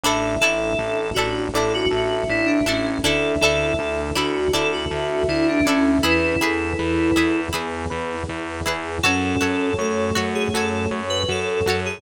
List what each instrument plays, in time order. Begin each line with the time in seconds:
0.04 synth bass 1 A1, pad 5 (bowed) D4 E4 A4, electric piano 1 D4, pizzicato strings D4 E4 A4, electric piano 2 A4, flute E5
0.40 synth bass 1 A1, pizzicato strings D4 E4 A4, electric piano 1 E4, electric piano 2 A4
0.79 synth bass 1 A1, electric piano 1 A4
1.14 synth bass 1 A1, pizzicato strings D4 E4, electric piano 1 D4, electric piano 2 F#4
1.19 pizzicato strings A4
1.54 synth bass 1 A1, pizzicato strings D4 E4 A4, electric piano 1 E4, electric piano 2 A4
1.74 electric piano 2 F#4
1.91 synth bass 1 A1, electric piano 1 A4, flute E5
2.29 synth bass 1 A1, electric piano 1 D4, electric piano 2 E4
2.45 electric piano 2 D4
2.66 synth bass 1 A1, electric piano 2 C#4, pizzicato strings D4 E4 A4, electric piano 1 E4
3.04 synth bass 1 D2, pad 5 (bowed) D4 E4 A4, pizzicato strings D4 E4 A4, electric piano 1 D4, electric piano 2 A4, flute E5
3.41 synth bass 1 D2, pizzicato strings D4 E4, electric piano 1 E4, electric piano 2 A4
3.45 pizzicato strings A4
3.79 synth bass 1 D2, electric piano 1 A4
4.15 synth bass 1 D2, pizzicato strings D4 E4 A4, electric piano 1 D4, electric piano 2 F#4
4.53 synth bass 1 D2, pizzicato strings D4 E4 A4, electric piano 1 E4, electric piano 2 A4
4.72 electric piano 2 F#4
4.91 synth bass 1 D2, electric piano 1 A4, flute E5
5.28 synth bass 1 D2, electric piano 1 D4, electric piano 2 E4
5.48 electric piano 2 D4
5.64 synth bass 1 D2, electric piano 2 C#4, pizzicato strings D4 E4, electric piano 1 E4
5.69 pizzicato strings A4
6.02 synth bass 1 E2, pad 5 (bowed) E4 G#4 B4, electric piano 2 E4, electric piano 1 E4, pizzicato strings E4 G#4 B4, flute B4
6.41 synth bass 1 E2, pizzicato strings E4 G#4 B4, electric piano 1 G#4, flute A4
6.79 synth bass 1 E2, electric piano 1 B4
7.16 synth bass 1 E2, electric piano 1 E4, pizzicato strings E4 G#4 B4
7.53 synth bass 1 E2, flute B3, pizzicato strings E4 G#4 B4, electric piano 1 G#4
7.90 synth bass 1 E2, electric piano 1 B4
8.29 synth bass 1 E2, electric piano 1 E4
8.66 synth bass 1 E2, pizzicato strings E4 G#4 B4, electric piano 1 G#4
9.03 synth bass 1 F#2, flute C#4, pizzicato strings F#4 A4 C#5, electric piano 1 F#4, pad 5 (bowed) F#4 A4 C#5, electric piano 2 A4
9.41 synth bass 1 F#2, pizzicato strings F#4 A4 C#5, electric piano 1 A4
9.78 synth bass 1 F#2, flute A3, electric piano 2 A4, electric piano 1 C#5
10.15 synth bass 1 F#2, pizzicato strings F#4 A4 C#5, electric piano 1 F#4
10.35 electric piano 2 G#4
10.54 synth bass 1 F#2, pizzicato strings F#4 A4 C#5, electric piano 1 A4, electric piano 2 A4
10.91 synth bass 1 F#2, electric piano 1 C#5
11.10 electric piano 2 B4
11.28 synth bass 1 F#2, electric piano 1 F#4, electric piano 2 A4
11.66 synth bass 1 F#2, pizzicato strings F#4 A4 C#5, electric piano 1 A4
11.86 electric piano 2 G#4